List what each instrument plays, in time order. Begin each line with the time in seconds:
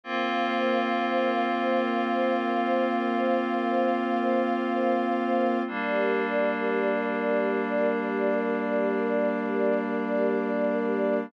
0.04 string ensemble 1 A#3 C5 F5, pad 5 (bowed) A#3 C4 F4
5.67 pad 5 (bowed) G3 A#3 D4, string ensemble 1 G4 A#4 D5